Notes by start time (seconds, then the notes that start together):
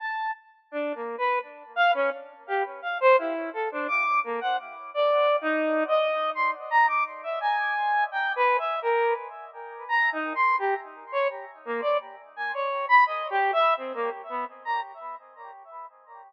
0.00 A5
0.71 D4
0.95 A#3
1.18 B4
1.76 F5
1.94 C#4
2.47 G4
2.82 F5
3.00 C5
3.18 E4
3.53 A4
3.72 D4
3.88 D6
4.24 A#3
4.41 F#5
4.94 D5
5.41 D#4
5.88 D#5
6.35 C6
6.71 A#5
6.88 D6
7.23 E5
7.41 G#5
8.12 G5
8.36 B4
8.59 E5
8.82 A#4
9.89 A#5
10.12 D#4
10.35 C6
10.59 G4
11.12 C#5
11.65 A#3
11.81 D5
12.36 G#5
12.54 C#5
12.89 B5
13.06 D#5
13.30 G4
13.53 E5
13.77 C4
13.94 A#3
14.29 B3
14.65 A#5